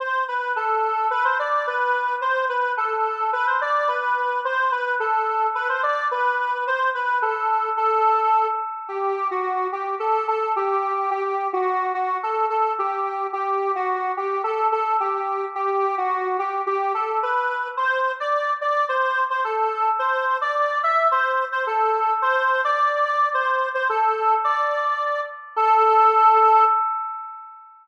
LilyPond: \new Staff { \time 2/4 \key a \dorian \tempo 4 = 108 c''8 b'8 a'4 | b'16 c''16 d''8 b'4 | c''8 b'8 a'4 | b'16 c''16 d''8 b'4 |
c''8 b'8 a'4 | b'16 c''16 d''8 b'4 | c''8 b'8 a'4 | a'4. r8 |
\key e \dorian g'8. fis'8. g'8 | a'8 a'8 g'4 | g'8. fis'8. fis'8 | a'8 a'8 g'4 |
g'8. fis'8. g'8 | a'8 a'8 g'4 | g'8. fis'8. g'8 | g'8 a'8 b'4 |
\key a \dorian c''8. d''8. d''8 | c''8. c''16 a'4 | c''8. d''8. e''8 | c''8. c''16 a'4 |
c''8. d''8. d''8 | c''8. c''16 a'4 | d''4. r8 | a'2 | }